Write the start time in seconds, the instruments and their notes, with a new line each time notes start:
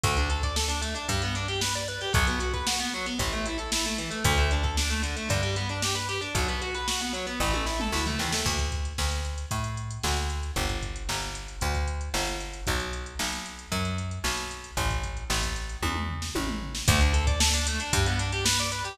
0.03 electric bass (finger) D2, overdriven guitar A3, kick, closed hi-hat
0.17 overdriven guitar D4, closed hi-hat
0.30 overdriven guitar A4, closed hi-hat
0.43 overdriven guitar D5, kick, closed hi-hat
0.56 overdriven guitar A4, snare
0.68 overdriven guitar D4, closed hi-hat
0.82 overdriven guitar A3, closed hi-hat
0.95 overdriven guitar D4, closed hi-hat
1.08 electric bass (finger) G2, overdriven guitar G3, kick, closed hi-hat
1.22 overdriven guitar B3, closed hi-hat
1.35 overdriven guitar D4, closed hi-hat
1.48 overdriven guitar G4, closed hi-hat
1.61 overdriven guitar B4, snare
1.75 overdriven guitar D5, closed hi-hat
1.88 overdriven guitar B4, closed hi-hat
2.01 overdriven guitar G4, closed hi-hat
2.13 electric bass (finger) B1, overdriven guitar F#3, kick, closed hi-hat
2.27 overdriven guitar B3, closed hi-hat
2.40 overdriven guitar F#4, closed hi-hat
2.53 overdriven guitar B4, kick, closed hi-hat
2.67 overdriven guitar F#4, snare
2.80 overdriven guitar B3, closed hi-hat
2.94 overdriven guitar F#3
3.06 overdriven guitar B3, closed hi-hat
3.19 electric bass (finger) A1, overdriven guitar E3, kick, closed hi-hat
3.33 overdriven guitar A3, closed hi-hat
3.46 overdriven guitar E4, closed hi-hat
3.58 overdriven guitar A4, closed hi-hat
3.72 overdriven guitar E4, snare
3.85 overdriven guitar A3, closed hi-hat
3.98 overdriven guitar E3, closed hi-hat
4.11 overdriven guitar A3, closed hi-hat
4.24 electric bass (finger) D2, overdriven guitar D3, kick, closed hi-hat
4.38 overdriven guitar A3, closed hi-hat
4.51 overdriven guitar D4, closed hi-hat
4.63 overdriven guitar A4, kick, closed hi-hat
4.77 overdriven guitar D4, snare
4.90 overdriven guitar A3, closed hi-hat
5.03 overdriven guitar D3, closed hi-hat
5.17 overdriven guitar A3, closed hi-hat
5.29 electric bass (finger) G2, overdriven guitar D3, kick, closed hi-hat
5.42 overdriven guitar G3, closed hi-hat
5.56 overdriven guitar B3, closed hi-hat
5.69 overdriven guitar D4, closed hi-hat
5.82 overdriven guitar G4, snare
5.95 overdriven guitar B4, closed hi-hat
6.09 overdriven guitar G4, closed hi-hat
6.21 overdriven guitar D4, closed hi-hat
6.35 electric bass (finger) B1, overdriven guitar F#3, kick, closed hi-hat
6.48 overdriven guitar B3, closed hi-hat
6.62 overdriven guitar F#4, closed hi-hat
6.74 overdriven guitar B4, closed hi-hat
6.88 overdriven guitar F#4, snare
7.01 overdriven guitar B3, closed hi-hat
7.13 overdriven guitar F#3, closed hi-hat
7.27 overdriven guitar B3, closed hi-hat
7.40 electric bass (finger) A1, overdriven guitar E3, kick, snare
7.54 overdriven guitar A3, high tom
7.66 overdriven guitar E4, snare
7.80 overdriven guitar A4, mid tom
7.92 electric bass (finger) D2, overdriven guitar E4, snare
8.06 overdriven guitar A3, floor tom
8.19 electric bass (finger) D#2, overdriven guitar E3, snare
8.32 overdriven guitar A3, snare
8.46 electric bass (finger) D2, kick, crash
8.59 kick, closed hi-hat
8.72 kick, closed hi-hat
8.85 closed hi-hat
8.98 electric bass (finger) D2, snare
9.12 closed hi-hat
9.25 closed hi-hat
9.38 closed hi-hat
9.51 electric bass (finger) A2, kick, closed hi-hat
9.64 closed hi-hat
9.77 closed hi-hat
9.91 closed hi-hat
10.03 electric bass (finger) D2, snare
10.17 closed hi-hat
10.30 closed hi-hat
10.43 closed hi-hat
10.56 electric bass (finger) G1, kick, closed hi-hat
10.69 kick, closed hi-hat
10.82 kick, closed hi-hat
10.96 closed hi-hat
11.09 electric bass (finger) G1, snare
11.22 closed hi-hat
11.35 closed hi-hat
11.48 closed hi-hat
11.61 electric bass (finger) D2, kick, closed hi-hat
11.75 kick, closed hi-hat
11.88 closed hi-hat
12.01 closed hi-hat
12.14 electric bass (finger) G1, snare
12.27 closed hi-hat
12.40 closed hi-hat
12.54 closed hi-hat
12.67 electric bass (finger) B1, kick, closed hi-hat
12.80 closed hi-hat
12.93 closed hi-hat
13.06 closed hi-hat
13.19 electric bass (finger) B1, snare
13.32 closed hi-hat
13.46 closed hi-hat
13.59 closed hi-hat
13.72 electric bass (finger) F#2, kick, closed hi-hat
13.85 closed hi-hat
13.98 closed hi-hat
14.11 closed hi-hat
14.24 electric bass (finger) B1, snare
14.38 closed hi-hat
14.51 closed hi-hat
14.64 closed hi-hat
14.77 electric bass (finger) A1, kick, closed hi-hat
14.90 kick, closed hi-hat
15.04 kick, closed hi-hat
15.17 closed hi-hat
15.30 electric bass (finger) A1, snare
15.43 kick, closed hi-hat
15.56 closed hi-hat
15.69 closed hi-hat
15.82 electric bass (finger) E2, kick, high tom
15.96 mid tom
16.09 floor tom
16.22 snare
16.35 electric bass (finger) A1, high tom
16.48 mid tom
16.62 floor tom
16.75 snare
16.88 electric bass (finger) D2, overdriven guitar A3, kick, closed hi-hat
17.01 overdriven guitar D4, closed hi-hat
17.13 overdriven guitar A4, closed hi-hat
17.27 overdriven guitar D5, kick, closed hi-hat
17.40 overdriven guitar A4, snare
17.54 overdriven guitar D4, closed hi-hat
17.67 overdriven guitar A3, closed hi-hat
17.80 overdriven guitar D4, closed hi-hat
17.93 electric bass (finger) G2, overdriven guitar G3, kick, closed hi-hat
18.06 overdriven guitar B3, closed hi-hat
18.19 overdriven guitar D4, closed hi-hat
18.32 overdriven guitar G4, closed hi-hat
18.45 overdriven guitar B4, snare
18.59 overdriven guitar D5, closed hi-hat
18.71 overdriven guitar B4, closed hi-hat
18.85 overdriven guitar G4, closed hi-hat